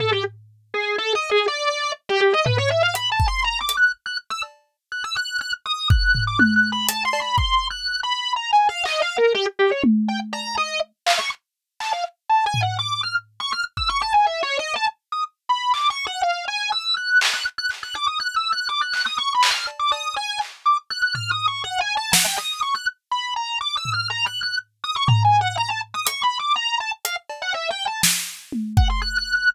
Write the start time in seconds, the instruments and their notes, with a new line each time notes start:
0.00 drawbar organ A4, floor tom
0.12 drawbar organ G4
0.74 drawbar organ G#4
0.98 drawbar organ A4
1.15 drawbar organ D#5
1.31 drawbar organ G#4
1.48 drawbar organ D5
2.09 drawbar organ G4
2.21 drawbar organ G4
2.33 drawbar organ D#5
2.46 drawbar organ B4, floor tom
2.58 drawbar organ C#5
2.70 drawbar organ E5
2.83 drawbar organ F5
2.95 drawbar organ B5, closed hi-hat
3.12 drawbar organ A5
3.20 kick
3.28 drawbar organ C6
3.44 drawbar organ A#5
3.61 drawbar organ D6
3.69 closed hi-hat
3.77 drawbar organ F#6
4.06 drawbar organ F#6
4.30 drawbar organ E6
4.43 cowbell
4.92 drawbar organ F#6
5.04 drawbar organ E6
5.16 drawbar organ F#6
5.41 drawbar organ F#6
5.66 drawbar organ D#6
5.90 drawbar organ F#6, kick
6.15 floor tom
6.27 drawbar organ D6
6.39 drawbar organ F#6, high tom
6.56 drawbar organ F#6
6.72 drawbar organ B5
6.89 drawbar organ A5, closed hi-hat
7.05 drawbar organ C6
7.13 cowbell
7.21 drawbar organ B5
7.38 drawbar organ C6, kick
7.70 drawbar organ F#6
8.03 drawbar organ B5
8.36 drawbar organ A#5
8.52 drawbar organ G#5
8.69 drawbar organ F5
8.85 drawbar organ D#5, clap
9.02 drawbar organ F5
9.18 drawbar organ A#4
9.35 drawbar organ G4
9.59 drawbar organ G4
9.71 drawbar organ C#5
9.84 high tom
10.08 drawbar organ G5
10.33 drawbar organ A#5, cowbell
10.57 drawbar organ D#5
11.06 drawbar organ F5, clap
11.19 drawbar organ C#6
11.80 drawbar organ A5, clap
11.93 drawbar organ F5
12.29 drawbar organ A5
12.46 drawbar organ G#5
12.54 floor tom
12.62 drawbar organ F#5
12.79 drawbar organ D6
13.03 drawbar organ F6
13.40 drawbar organ C#6
13.52 drawbar organ F6
13.77 drawbar organ E6, kick
13.89 drawbar organ C#6
14.02 drawbar organ A5
14.14 drawbar organ G#5
14.26 drawbar organ E5
14.43 drawbar organ C#5
14.59 drawbar organ D#5
14.76 drawbar organ A5
15.12 drawbar organ D#6
15.49 drawbar organ B5
15.74 drawbar organ D6, clap
15.90 drawbar organ C#6
16.07 drawbar organ F#5
16.23 drawbar organ F5
16.48 drawbar organ G#5
16.72 drawbar organ E6
16.97 drawbar organ F#6
17.21 clap
17.33 drawbar organ F#6
17.58 drawbar organ F#6
17.70 clap
17.83 drawbar organ F#6
17.95 drawbar organ D6
18.07 drawbar organ D#6
18.20 drawbar organ F#6
18.36 drawbar organ E6
18.52 drawbar organ F#6
18.69 drawbar organ D6
18.81 drawbar organ F#6
18.93 drawbar organ F#6, clap
19.06 drawbar organ D#6
19.18 drawbar organ C#6
19.34 drawbar organ B5
19.43 clap
19.51 drawbar organ F6
19.67 cowbell
19.79 drawbar organ D6
19.92 drawbar organ D#6, cowbell
20.16 drawbar organ G#5
20.41 clap
20.66 drawbar organ D6
20.90 drawbar organ F#6
21.02 drawbar organ F#6
21.15 drawbar organ F6, floor tom
21.31 drawbar organ D#6
21.48 drawbar organ C#6
21.64 drawbar organ F#5
21.80 drawbar organ G#5
21.97 drawbar organ A5
22.13 drawbar organ F#5, snare
22.25 drawbar organ G5
22.38 drawbar organ D#6
22.62 drawbar organ C#6
22.75 drawbar organ F#6
23.11 drawbar organ B5
23.36 drawbar organ A#5
23.61 drawbar organ D6
23.77 drawbar organ E6
23.85 floor tom
23.93 drawbar organ F6
24.10 drawbar organ A#5
24.26 drawbar organ F#6
24.43 drawbar organ F#6
24.84 drawbar organ D#6
24.96 drawbar organ C#6
25.08 drawbar organ A#5, floor tom
25.24 drawbar organ G#5
25.41 drawbar organ F#5
25.57 drawbar organ A#5
25.70 drawbar organ A5
25.94 drawbar organ D#6
26.07 drawbar organ C#6, closed hi-hat
26.23 drawbar organ B5
26.39 drawbar organ D6
26.56 drawbar organ A#5
26.80 drawbar organ A5
27.05 drawbar organ F5, closed hi-hat
27.30 cowbell
27.42 drawbar organ F#5
27.54 drawbar organ E5
27.70 drawbar organ G5
27.87 drawbar organ A5
28.03 snare
28.52 high tom
28.77 drawbar organ F#5, kick
28.89 drawbar organ C6
29.02 drawbar organ F#6
29.18 drawbar organ F#6
29.35 drawbar organ F#6